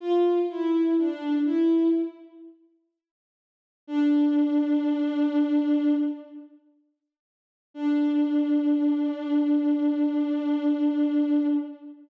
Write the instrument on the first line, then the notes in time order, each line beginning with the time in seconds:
violin
0.00 F4
0.49 E4
0.97 D4
1.45 E4
3.88 D4
7.74 D4